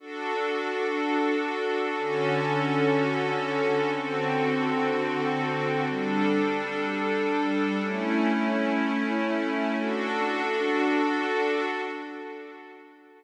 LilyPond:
\new Staff { \time 3/4 \key d \major \tempo 4 = 92 <d' fis' a'>2. | <d cis' fis' a'>2. | <d c' fis' a'>2. | <g d' a'>2. |
<a cis' e'>2. | <d' fis' a'>2. | }